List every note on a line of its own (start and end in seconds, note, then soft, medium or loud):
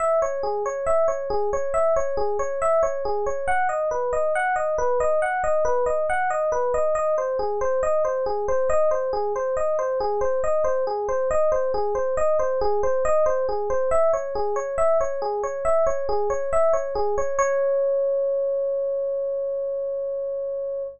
0.00 0.20 E5 medium
0.22 0.42 C#5 medium
0.43 0.63 G#4 medium
0.66 0.86 C#5 medium
0.86 1.07 E5 medium
1.08 1.28 C#5 medium
1.30 1.50 G#4 medium
1.53 1.73 C#5 medium
1.74 1.94 E5 medium
1.96 2.16 C#5 medium
2.17 2.37 G#4 medium
2.39 2.59 C#5 medium
2.62 2.82 E5 medium
2.83 3.03 C#5 medium
3.05 3.25 G#4 medium
3.26 3.46 C#5 medium
3.48 3.68 F#5 medium
3.69 3.89 D#5 medium
3.91 4.11 B4 medium
4.13 4.33 D#5 medium
4.35 4.55 F#5 medium
4.56 4.76 D#5 medium
4.78 4.98 B4 medium
5.00 5.20 D#5 medium
5.22 5.42 F#5 medium
5.44 5.64 D#5 medium
5.65 5.85 B4 medium
5.86 6.06 D#5 medium
6.10 6.30 F#5 medium
6.30 6.50 D#5 medium
6.52 6.72 B4 medium
6.74 6.94 D#5 medium
6.95 7.15 D#5 medium
7.18 7.38 C5 medium
7.39 7.59 G#4 medium
7.61 7.81 C5 medium
7.83 8.03 D#5 medium
8.05 8.25 C5 medium
8.26 8.46 G#4 medium
8.48 8.68 C5 medium
8.70 8.89 D#5 medium
8.91 9.11 C5 medium
9.13 9.33 G#4 medium
9.36 9.56 C5 medium
9.57 9.77 D#5 medium
9.79 9.99 C5 medium
10.00 10.20 G#4 medium
10.21 10.41 C5 medium
10.44 10.64 D#5 medium
10.64 10.84 C5 medium
10.87 11.07 G#4 medium
11.09 11.29 C5 medium
11.31 11.51 D#5 medium
11.52 11.72 C5 medium
11.74 11.94 G#4 medium
11.95 12.15 C5 medium
12.17 12.37 D#5 medium
12.39 12.59 C5 medium
12.61 12.81 G#4 medium
12.83 13.03 C5 medium
13.05 13.25 D#5 medium
13.26 13.46 C5 medium
13.49 13.69 G#4 medium
13.70 13.90 C5 medium
13.91 14.11 E5 medium
14.13 14.33 C#5 medium
14.35 14.55 G#4 medium
14.56 14.76 C#5 medium
14.78 14.98 E5 medium
15.01 15.21 C#5 medium
15.22 15.42 G#4 medium
15.43 15.63 C#5 medium
15.65 15.85 E5 medium
15.87 16.07 C#5 medium
16.09 16.29 G#4 medium
16.30 16.50 C#5 medium
16.53 16.73 E5 medium
16.73 16.93 C#5 medium
16.95 17.15 G#4 medium
17.18 17.38 C#5 medium
17.39 20.83 C#5 loud